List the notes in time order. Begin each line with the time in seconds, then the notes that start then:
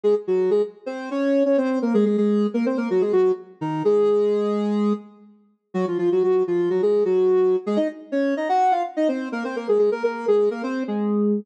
0.04 G#3 G#4
0.27 F#3 F#4
0.51 G#3 G#4
0.86 C4 C5
1.11 C#4 C#5
1.45 C#4 C#5
1.58 C4 C5
1.82 A#3 A#4
1.94 G#3 G#4
2.05 G#3 G#4
2.18 G#3 G#4
2.54 A#3 A#4
2.66 C4 C5
2.77 A#3 A#4
2.90 F#3 F#4
3.01 G#3 G#4
3.13 F#3 F#4
3.61 D#3 D#4
3.85 G#3 G#4
5.74 F#3 F#4
5.88 F3 F4
5.98 F3 F4
6.12 F#3 F#4
6.23 F#3 F#4
6.47 F3 F4
6.70 F#3 F#4
6.82 G#3 G#4
7.05 F#3 F#4
7.66 G#3 G#4
7.76 D#4 D#5
8.12 C#4 C#5
8.37 D#4 D#5
8.49 F#4 F#5
8.71 F4 F5
8.97 D#4 D#5
9.08 C4 C5
9.32 A#3 A#4
9.44 C4 C5
9.56 A#3 A#4
9.68 G#3 G#4
9.79 G#3 G#4
9.92 A#3 A#4
10.04 A#3 A#4
10.28 G#3 G#4
10.51 A#3 A#4
10.63 C4 C5
10.88 G#3 G#4